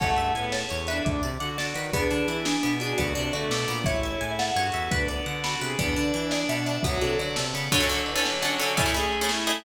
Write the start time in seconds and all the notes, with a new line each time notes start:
0.00 A1 A3 C#4 E4 G#4 A4 C#5 F#5 A5, kick, crash
0.16 G2 E5, closed hi-hat
0.35 A2 B3 G#5, closed hi-hat
0.52 C#5 A5, snare
0.69 E2 C#5, closed hi-hat
0.87 D4 B4 E5, closed hi-hat
1.05 D2 D4 D6, kick, closed hi-hat
1.23 C3 D5, closed hi-hat
1.40 D3 F#4 F#5 D6, closed hi-hat
1.58 D3 D5 A5, snare
1.74 D#3 B4, closed hi-hat
1.93 E2 B3 D4 E4 G#4 B4, kick, closed hi-hat
2.11 D3 D4, closed hi-hat
2.28 E3 E4, closed hi-hat
2.45 D4 G#4, snare
2.63 B2 B3, closed hi-hat
2.80 D4 F#4 G#4, closed hi-hat
2.98 D2 B3 D4 F#4 A4 D5, kick, closed hi-hat
3.15 C3 D4, closed hi-hat
3.33 D3 A3 F#4 D5, closed hi-hat
3.50 B2 A4 D6, snare
3.68 A#2 B3, closed hi-hat
3.84 A1 C#4 E4 G#4 A4 C#5 E5, kick, closed hi-hat
4.03 E5, closed hi-hat
4.21 A2 E4 G#5, closed hi-hat
4.39 F#5 A5, snare
4.56 G2 F#4 C#5, closed hi-hat
4.72 E2 E5, closed hi-hat
4.91 D2 B3 D4 F#4 A4 B4, kick, closed hi-hat
5.08 B3 D5, closed hi-hat
5.26 D3 F#5, closed hi-hat
5.44 F#4 A5 B5, snare
5.61 C3 G#4 B4, closed hi-hat
5.79 E2 B3 D4 B4 D5 E5 G#5, kick, closed hi-hat
5.96 D3 D4, closed hi-hat
6.14 E3 E4, closed hi-hat
6.31 G#4 D5, snare
6.49 B2 B3 E5, closed hi-hat
6.66 D4, closed hi-hat
6.83 D2 F#3 B3 F#4 B4 D5 F#5 A5, kick, closed hi-hat
7.01 C3 D4 A4, closed hi-hat
7.19 D3 F#4 D5, closed hi-hat
7.36 C3 A4, snare
7.53 C#3 B3, closed hi-hat
7.72 D3 F#3 C#4 F#4 A4, kick, crash
7.80 D3 C#4 F#4 A4
7.89 D3 C#4 F#4 A4, ride
8.06 E3, ride
8.16 D3 C#4 F#4 A4
8.24 F#3, snare
8.42 D3 C#4 F#4 A4, ride
8.58 D3 C#4 F#4 A4, ride
8.77 A3 C#4 E4 G#4, kick, ride
8.86 A3 C#4 E4 G#4
8.94 A3 C#4 E4 G#4, ride
9.12 ride
9.21 A3 C#4 E4 G#4
9.29 E4, snare
9.47 A3 C#4 E4 G#4, ride